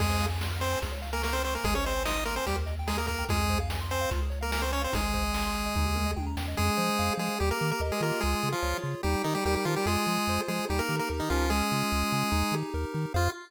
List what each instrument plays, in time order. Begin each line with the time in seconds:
0.00 synth bass 1 F2, lead 1 (square) G#3 G#4, kick, crash
0.10 lead 1 (square) C5
0.21 lead 1 (square) F5, closed hi-hat
0.31 lead 1 (square) G#5
0.41 lead 1 (square) C6, snare
0.52 lead 1 (square) F6
0.60 lead 1 (square) C4 C5 C6, closed hi-hat
0.72 lead 1 (square) G#5
0.82 synth bass 1 C#2, lead 1 (square) G#4, kick, closed hi-hat
0.91 lead 1 (square) C#5
1.02 lead 1 (square) F5, closed hi-hat
1.13 lead 1 (square) A#3 A#4 G#5
1.22 lead 1 (square) A#3 A#4 C#6, snare
1.33 lead 1 (square) C4 C5 F6
1.44 lead 1 (square) C4 C5 C#6, open hi-hat
1.54 lead 1 (square) A#3 A#4 G#5
1.64 synth bass 1 G#1, lead 1 (square) G#3 G#4, kick, closed hi-hat
1.75 lead 1 (square) C#4 C5 C#5
1.85 lead 1 (square) C4 C5 D#5, closed hi-hat
1.96 lead 1 (square) G#5
2.05 lead 1 (square) D#4 D#5 C6, snare
2.15 lead 1 (square) D#6
2.25 lead 1 (square) A#3 A#4 C6, closed hi-hat
2.36 lead 1 (square) C4 C5 G#5
2.46 synth bass 1 D#2, lead 1 (square) G3 G4, kick, closed hi-hat
2.56 lead 1 (square) A#4
2.66 lead 1 (square) D#5, closed hi-hat
2.79 lead 1 (square) G5
2.87 lead 1 (square) G#3 G#4 A#5, snare
2.97 lead 1 (square) A#3 A#4 D#6
3.07 lead 1 (square) A#3 A#4 A#5, kick, closed hi-hat
3.18 lead 1 (square) G5
3.29 synth bass 1 F2, lead 1 (square) G#3 F4 G#4, kick, closed hi-hat
3.40 lead 1 (square) G#4
3.49 lead 1 (square) C5, kick, closed hi-hat
3.60 lead 1 (square) F5
3.70 lead 1 (square) G#5, snare
3.81 lead 1 (square) C6
3.90 lead 1 (square) C4 C5 G#5, closed hi-hat
4.01 lead 1 (square) F5
4.11 synth bass 1 C#2, lead 1 (square) F4, kick, closed hi-hat
4.22 lead 1 (square) G#4
4.30 lead 1 (square) C#5, closed hi-hat
4.41 lead 1 (square) A#3 A#4 F5
4.52 lead 1 (square) A#3 A#4 G#5, snare
4.62 lead 1 (square) C4 C5 C#6
4.71 lead 1 (square) C#4 C#5 G#5, closed hi-hat
4.81 lead 1 (square) C4 C5 F5
4.92 synth bass 1 G#1, lead 1 (square) G#3 D#4 G#4, kick, closed hi-hat
5.04 lead 1 (square) G#4
5.14 lead 1 (square) C5, kick, closed hi-hat
5.23 lead 1 (square) D#5
5.33 lead 1 (square) G#5, snare
5.44 lead 1 (square) C6
5.55 lead 1 (square) G#5, closed hi-hat
5.66 lead 1 (square) D#5
5.75 synth bass 1 D#2, lead 1 (square) D#4, kick, floor tom
5.86 lead 1 (square) G4
5.95 lead 1 (square) A#4, mid tom
6.06 lead 1 (square) D#5
6.16 synth bass 1 D#2, lead 1 (square) G5, high tom
6.27 lead 1 (square) A#5
6.37 synth bass 1 E2, lead 1 (square) G5, snare
6.48 lead 1 (square) D#5
6.57 synth bass 1 F2, lead 1 (square) G#3 G#4
6.77 synth bass 1 F3, lead 1 (square) C5
6.99 synth bass 1 F2, lead 1 (square) F5
7.18 synth bass 1 F3, lead 1 (square) G#3 G#4
7.40 synth bass 1 D#2, lead 1 (square) G3 G4
7.51 lead 1 (square) A#3 A#4
7.61 synth bass 1 D#3, lead 1 (square) A#4
7.71 lead 1 (square) A#3 A#4
7.80 synth bass 1 D#2, lead 1 (square) D#5
7.92 lead 1 (square) G#3 G#4
8.00 synth bass 1 D#3, lead 1 (square) A#3 F4 A#4
8.21 synth bass 1 C#2, lead 1 (square) G#3 G#4
8.43 synth bass 1 C#3, lead 1 (square) G#4
8.52 lead 1 (square) F3 F4
8.62 synth bass 1 C#2, lead 1 (square) C#5
8.82 synth bass 1 C#3, lead 1 (square) F4
9.03 synth bass 1 D#2, lead 1 (square) G3 D#4 G4
9.24 lead 1 (square) D#3 D#4 G4, synth bass 1 D#3
9.35 lead 1 (square) G3 G4
9.45 synth bass 1 D#2, lead 1 (square) G3 G4 A#4
9.55 lead 1 (square) G3 G4
9.65 synth bass 1 D#3, lead 1 (square) F3 D#4 F4
9.76 lead 1 (square) G3 G4
9.86 synth bass 1 F2, lead 1 (square) G#3 F4 G#4
10.06 synth bass 1 F3, lead 1 (square) G#4
10.27 synth bass 1 F2, lead 1 (square) C5
10.48 synth bass 1 F3, lead 1 (square) G#3 F4 G#4
10.69 synth bass 1 D#2, lead 1 (square) G3 D#4 G4
10.79 lead 1 (square) A#3 A#4
10.88 synth bass 1 D#3, lead 1 (square) G4
10.99 lead 1 (square) A#3 A#4
11.09 synth bass 1 D#2, lead 1 (square) A#4
11.20 lead 1 (square) D#3 D#4
11.30 synth bass 1 C#2, lead 1 (square) F3 C#4 F4
11.50 lead 1 (square) G#3 G#4
11.71 synth bass 1 C#3, lead 1 (square) F4
11.92 synth bass 1 C#2, lead 1 (square) G#4
12.12 synth bass 1 C#3, lead 1 (square) C#4
12.31 synth bass 1 D#2, lead 1 (square) D#4
12.52 synth bass 1 D#3, lead 1 (square) G4
12.74 synth bass 1 D#2, lead 1 (square) A#4
12.94 synth bass 1 D#3, lead 1 (square) D#4
13.14 synth bass 1 F2, lead 1 (square) F4 G#4 C5 F5